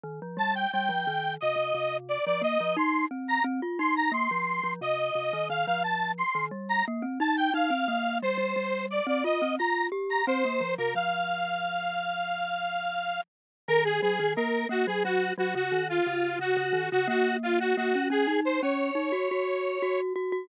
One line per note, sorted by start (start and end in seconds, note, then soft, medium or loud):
0.04 0.20 D#3 medium
0.22 0.38 F3 medium
0.37 0.66 G3 medium
0.37 0.54 A5 medium
0.55 0.71 G5 medium
0.72 0.90 G3 medium
0.72 1.35 G5 medium
0.89 1.05 F3 medium
1.07 1.37 D#3 medium
1.41 1.56 C3 medium
1.41 1.97 D#5 medium
1.56 1.72 C3 medium
1.74 2.18 C3 medium
2.09 2.25 D5 medium
2.26 2.43 F3 medium
2.26 2.42 D5 medium
2.41 2.58 A#3 medium
2.41 2.76 D#5 medium
2.61 2.77 F3 medium
2.77 3.06 D#4 medium
2.77 3.06 C6 medium
3.11 3.39 C4 medium
3.28 3.44 A#5 medium
3.44 3.61 C4 medium
3.62 3.79 F4 medium
3.79 4.10 D#4 medium
3.79 3.95 C6 medium
3.96 4.12 A#5 medium
4.12 4.28 A#3 medium
4.12 4.73 C6 medium
4.31 4.61 F3 medium
4.63 4.80 F3 medium
4.81 5.10 C3 medium
4.81 5.48 D#5 medium
5.15 5.32 C3 medium
5.33 5.49 D#3 medium
5.50 5.66 D#3 medium
5.50 5.66 F5 medium
5.66 6.23 F3 medium
5.66 5.83 F5 medium
5.84 6.12 A5 medium
6.18 6.46 C6 medium
6.35 6.51 D#3 medium
6.51 6.82 G3 medium
6.69 6.85 A#5 medium
6.88 7.04 A#3 medium
7.02 7.19 C4 medium
7.20 7.50 D#4 medium
7.20 7.36 A5 medium
7.37 7.53 G5 medium
7.54 7.70 D#4 medium
7.54 8.18 F5 medium
7.70 7.87 C4 medium
7.88 8.20 A#3 medium
8.22 8.37 G3 medium
8.22 8.86 C5 medium
8.38 8.54 G3 medium
8.56 9.00 G3 medium
8.90 9.07 D5 medium
9.07 9.23 C4 medium
9.07 9.24 D5 medium
9.24 9.40 F4 medium
9.24 9.55 D#5 medium
9.42 9.58 C4 medium
9.59 9.89 F4 medium
9.59 9.87 A#5 medium
9.92 10.22 G4 medium
10.10 10.26 A#5 medium
10.27 10.43 C4 medium
10.27 10.75 C5 medium
10.45 10.61 A#3 medium
10.61 10.77 F3 medium
10.78 10.95 C3 medium
10.78 10.94 A#4 medium
10.95 13.19 F3 medium
10.95 13.21 F5 medium
13.68 14.00 D#3 loud
13.68 13.84 A#4 loud
13.85 14.01 G#4 medium
14.02 14.19 F#3 medium
14.02 14.33 G#4 medium
14.19 14.36 D#3 medium
14.36 14.65 A#3 medium
14.36 14.67 A#4 medium
14.69 14.85 A#3 medium
14.69 14.86 F#4 medium
14.87 15.03 F#3 medium
14.87 15.03 G#4 medium
15.04 15.32 F#3 medium
15.04 15.33 F#4 medium
15.38 15.54 F#3 medium
15.38 15.55 F#4 medium
15.55 15.71 C#3 medium
15.55 15.88 F#4 medium
15.72 16.00 D#3 medium
15.89 16.39 F4 medium
16.07 16.37 C#3 medium
16.39 16.55 C#3 medium
16.39 16.89 F#4 medium
16.57 16.73 C#3 medium
16.73 16.89 D#3 medium
16.91 17.09 C#3 medium
16.91 17.08 F#4 medium
17.08 17.74 A#3 medium
17.08 17.37 F#4 medium
17.43 17.59 F4 medium
17.60 17.76 F#4 medium
17.77 17.94 A#3 medium
17.77 18.08 F#4 medium
17.95 18.10 C#4 medium
18.10 18.26 C#4 medium
18.10 18.40 G#4 medium
18.27 18.60 D#4 medium
18.45 18.61 C5 medium
18.62 18.90 C#4 medium
18.62 20.01 C#5 medium
18.95 19.11 D#4 medium
19.12 19.28 F#4 medium
19.31 19.78 F#4 medium
19.82 20.13 F#4 medium
20.16 20.32 F#4 medium
20.32 20.48 F#4 medium